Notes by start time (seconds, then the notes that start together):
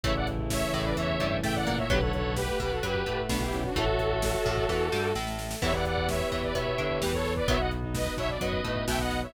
0.04 A1 C#3 E3 A3 E4 C#5 E5, kick, closed hi-hat
0.16 D5 F#5, kick
0.27 kick, closed hi-hat
0.39 kick
0.50 C#5 E5, kick, snare
0.62 kick
0.73 A1 A2 C#5 E5, kick, closed hi-hat
0.85 B4 D5, kick
0.97 E2 E3 C#5 E5, kick, closed hi-hat
1.09 kick
1.20 G2 G3, kick, closed hi-hat
1.32 kick
1.43 A2 A3 E5 G5, kick, snare
1.55 D5 F#5, kick
1.67 A#2 A#3, kick, snare, closed hi-hat
1.78 C#5 E5, kick
1.90 B1 D3 F#3 B3 G4 B4 F#5, kick, closed hi-hat
2.01 A4 C#5, kick
2.13 A4 C#5, kick, closed hi-hat
2.25 kick
2.37 G4 B4, kick, snare
2.48 A3, kick
2.59 B1 B2 G4 B4, kick, closed hi-hat
2.71 F#4 A4, kick
2.83 F#2 F#3 G4 B4, kick, closed hi-hat
2.95 kick
3.06 A2 A3, kick, closed hi-hat
3.18 kick
3.29 B1 B2 D4 F#4, kick, snare
3.41 E4 G4, kick
3.53 C#4, kick, snare, closed hi-hat
3.64 D4 F#4, kick
3.76 A1 E3 A3 F#4 A4 C#5 E5, kick, closed hi-hat
3.87 kick
3.99 kick, closed hi-hat
4.11 kick
4.22 kick, snare
4.34 kick
4.46 A1 A2, kick, closed hi-hat
4.57 kick
4.69 E2 E3, kick, snare
4.92 G2 G3, snare
5.15 A1 A2, snare
5.27 snare
5.39 snare
5.51 snare
5.62 E2 E3 B3 E4 G4 B4 C#5 E5, kick, crash
5.74 D5 F#5, kick
5.85 D5 F#5, kick, closed hi-hat
5.97 kick
6.09 C#5 E5, kick, snare
6.20 kick
6.31 E2 E3 C#5 E5, kick, closed hi-hat
6.43 B4 D5, kick
6.54 B2 B3 C#5 E5, kick, closed hi-hat
6.67 kick
6.78 D3 D4, kick, closed hi-hat
6.90 kick
7.01 E2 E3 G4 B4, kick, snare
7.13 A4 C#5, kick
7.25 kick, snare
7.36 B4 D5, kick
7.48 B1 D#3 F#3 B3 D#4 F#4 C#5 E5, kick, closed hi-hat
7.60 D#5 F#5, kick
7.71 kick, closed hi-hat
7.83 D#4, kick
7.94 B4 D#5, kick, snare
8.06 kick
8.17 B1 B2 C#5 E5, kick, closed hi-hat
8.29 D5, kick
8.41 F#2 F#3 B4 D#5, kick, closed hi-hat
8.53 kick
8.64 A2 A3, kick, closed hi-hat
8.76 kick
8.88 B1 B2 E5 G5, kick, snare
8.99 D#5 F#5, kick
9.11 kick, snare, closed hi-hat
9.23 C#5 E5, kick